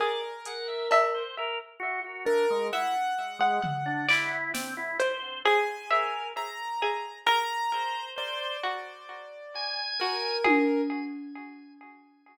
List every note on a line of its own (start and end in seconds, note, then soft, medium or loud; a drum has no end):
0.00 0.82 G#4 medium
0.00 1.23 A#4 medium
0.00 0.21 D5 medium
0.45 0.67 F#5 medium
0.45 closed hi-hat medium
0.68 0.88 E5 medium
0.91 1.74 E5 loud
0.91 cowbell loud
1.14 1.35 C5 medium
1.38 1.59 A#4 loud
1.80 2.00 F#4 loud
2.04 2.25 F#4 medium
2.25 2.46 D4 medium
2.25 2.67 A#4 loud
2.50 2.71 G#3 medium
2.73 2.94 E4 medium
2.73 3.14 E5 medium
2.73 4.36 F#5 loud
3.39 3.60 G#3 loud
3.39 3.61 F#5 medium
3.63 4.03 F#5 medium
3.63 floor tom medium
3.86 4.06 D4 loud
4.09 4.51 E4 loud
4.09 4.90 D5 loud
4.09 clap medium
4.54 4.74 C4 medium
4.54 snare medium
4.77 4.98 E4 loud
5.00 5.41 C5 medium
5.00 closed hi-hat medium
5.45 5.86 G#4 loud
5.45 6.27 G#5 medium
5.91 6.32 A#4 medium
5.91 6.72 E5 medium
6.37 7.19 A#5 medium
6.82 7.23 G#4 medium
7.27 8.09 A#4 loud
7.27 8.08 A#5 loud
7.74 8.15 C5 medium
8.16 8.57 C5 loud
8.16 9.81 D5 medium
8.63 9.86 F#4 medium
9.55 10.37 G#5 loud
10.00 10.42 F#4 medium
10.00 10.81 A#4 medium
10.44 10.85 G#4 loud
10.44 high tom medium